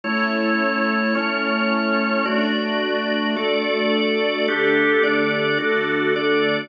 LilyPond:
<<
  \new Staff \with { instrumentName = "String Ensemble 1" } { \time 12/8 \key e \dorian \tempo 4. = 108 <a cis' e'>1. | <a d' fis'>1. | <d a g'>2. <d a fis'>2. | }
  \new Staff \with { instrumentName = "Drawbar Organ" } { \time 12/8 \key e \dorian <a e' cis''>2. <a cis' cis''>2. | <a fis' d''>2. <a a' d''>2. | <d' g' a'>4. <d' a' d''>4. <d' fis' a'>4. <d' a' d''>4. | }
>>